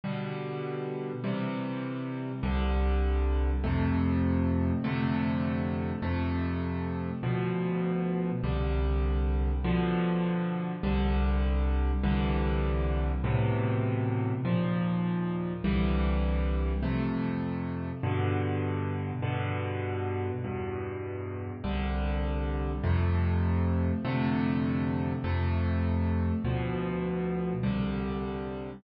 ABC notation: X:1
M:4/4
L:1/8
Q:1/4=100
K:C
V:1 name="Acoustic Grand Piano"
[B,,D,G,]4 [C,E,G,]4 | [C,,D,G,]4 [F,,C,A,]4 | [F,,C,D,A,]4 [F,,C,A,]4 | [D,,B,,F,]4 [C,,D,G,]4 |
[B,,D,F,]4 [C,,D,G,]4 | [C,,D,E,G,]4 [A,,B,,C,E,]4 | [_E,,_B,,F,]4 [C,,D,=E,G,]4 | [F,,C,A,]4 [G,,B,,D,]4 |
[G,,B,,D,]4 [E,,G,,B,,]4 | [C,,D,G,]4 [F,,C,A,]4 | [F,,C,D,A,]4 [F,,C,A,]4 | [D,,B,,F,]4 [C,,D,G,]4 |]